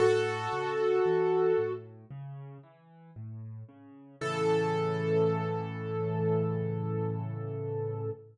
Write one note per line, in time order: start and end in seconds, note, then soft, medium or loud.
0.00 0.48 A2 medium
0.00 1.72 F#4 medium
0.00 1.72 A4 loud
0.53 1.00 C#3 medium
1.05 1.53 E3 medium
1.58 2.05 A2 medium
2.11 2.58 C#3 medium
2.63 3.11 E3 medium
3.16 3.64 A2 medium
3.69 4.16 C#3 medium
4.21 8.10 A2 loud
4.21 8.10 C#3 medium
4.21 8.10 E3 loud
4.21 8.10 A4 loud